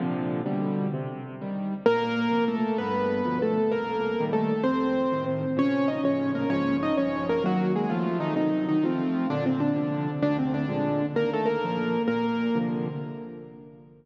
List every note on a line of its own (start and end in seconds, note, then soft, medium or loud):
0.00 0.41 A#2 medium
0.00 0.41 C3 medium
0.00 0.41 D3 medium
0.00 0.41 F3 medium
0.46 0.88 B2 medium
0.46 0.88 D3 medium
0.46 0.88 G3 medium
0.94 1.35 C3 medium
1.41 1.74 D#3 medium
1.41 1.74 G3 medium
1.86 2.28 A#2 medium
1.86 2.45 A#3 loud
1.86 2.45 A#4 loud
2.31 2.64 C3 medium
2.31 2.64 F3 medium
2.48 2.77 A3 medium
2.48 2.77 A4 medium
2.78 3.22 G2 medium
2.78 3.38 B3 medium
2.78 3.38 B4 medium
3.25 3.58 B2 medium
3.25 3.58 D3 medium
3.25 3.58 F3 medium
3.42 3.72 A3 medium
3.42 3.72 A4 medium
3.72 4.15 C2 medium
3.72 4.24 A#3 medium
3.72 4.24 A#4 medium
4.20 4.53 A#2 medium
4.20 4.53 D#3 medium
4.20 4.53 G3 medium
4.33 4.62 A3 medium
4.33 4.62 A4 medium
4.64 5.06 F2 medium
4.64 5.24 C4 medium
4.64 5.24 C5 medium
5.12 5.45 A2 medium
5.12 5.45 C3 medium
5.12 5.45 D#3 medium
5.57 5.99 A#2 medium
5.57 5.99 C#3 medium
5.57 5.99 F3 medium
5.57 5.89 C#4 medium
5.57 5.89 C#5 loud
5.88 6.01 D#4 medium
5.88 6.01 D#5 medium
6.03 6.45 A#1 medium
6.03 6.45 A2 medium
6.03 6.45 C#3 medium
6.03 6.45 F3 medium
6.03 6.31 C#4 medium
6.03 6.31 C#5 medium
6.35 6.49 A#3 medium
6.35 6.49 A#4 medium
6.50 6.92 A#1 medium
6.50 6.92 G#2 medium
6.50 6.92 C#3 medium
6.50 6.92 F3 medium
6.50 6.76 C#4 medium
6.50 6.76 C#5 medium
6.83 6.96 D#4 medium
6.83 6.96 D#5 medium
6.97 7.40 A#1 medium
6.97 7.40 G2 medium
6.97 7.40 C#3 medium
6.97 7.40 F3 medium
6.97 7.25 C#4 medium
6.97 7.25 C#5 medium
7.29 7.43 A#3 medium
7.29 7.43 A#4 medium
7.44 7.85 D#3 medium
7.44 7.85 F#3 medium
7.44 7.72 F#3 medium
7.44 7.85 A#3 medium
7.44 7.72 F#4 loud
7.76 7.90 G#3 medium
7.76 7.90 G#4 medium
7.90 8.33 C3 medium
7.90 8.17 F3 medium
7.90 8.33 F3 medium
7.90 8.33 A3 medium
7.90 8.17 F4 medium
8.20 8.34 D#3 medium
8.20 8.34 D#4 medium
8.36 8.78 C3 medium
8.36 8.66 D#3 medium
8.36 8.78 F#3 medium
8.36 8.78 D#4 medium
8.36 8.66 D#4 medium
8.69 8.83 D#3 medium
8.69 8.83 D#4 medium
8.84 9.26 F3 medium
8.84 9.27 A3 medium
8.84 9.27 C4 medium
8.84 9.26 F4 medium
9.30 9.73 A#2 medium
9.30 9.44 D3 medium
9.30 9.44 D4 loud
9.46 9.60 C3 medium
9.46 9.60 C4 medium
9.60 10.11 D3 medium
9.60 10.11 D4 medium
9.75 10.08 C3 medium
9.75 10.08 D3 medium
9.75 10.08 F3 medium
10.22 10.65 D2 loud
10.22 10.37 D3 loud
10.22 10.37 D4 loud
10.39 10.53 C3 medium
10.39 10.53 C4 medium
10.54 11.06 D3 medium
10.54 11.06 D4 medium
10.68 11.01 A#2 medium
10.68 11.01 F3 medium
10.68 11.01 G#3 medium
11.15 11.57 D#2 loud
11.15 11.30 A#3 medium
11.15 11.30 A#4 medium
11.33 11.48 A3 medium
11.33 11.48 A4 medium
11.46 12.02 A#3 medium
11.46 12.02 A#4 medium
11.64 11.97 A#2 medium
11.64 11.97 F3 medium
12.08 12.49 A#2 medium
12.08 12.58 A#3 medium
12.08 12.58 A#4 medium
12.55 12.88 C3 medium
12.55 12.88 D3 medium
12.55 12.88 F3 medium